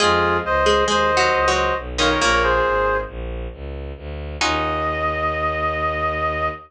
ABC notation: X:1
M:5/4
L:1/16
Q:1/4=136
K:Ebdor
V:1 name="Clarinet"
[FA]4 [ce]4 [ce]6 [ce]2 z2 [df] [Bd] | [Bd] [Bd] [Ac]6 z12 | e20 |]
V:2 name="Pizzicato Strings"
[A,A]6 [A,A]2 (3[A,A]4 [G,G]4 [G,G]4 z2 [E,E]2 | [B,,B,]8 z12 | E20 |]
V:3 name="Orchestral Harp"
[CEFA]18 [B,DFA]2- | [B,DFA]20 | [DEFG]20 |]
V:4 name="Violin" clef=bass
F,,4 D,,4 E,,4 D,,4 =B,,,4 | B,,,4 A,,,4 B,,,4 D,,4 =D,,4 | E,,20 |]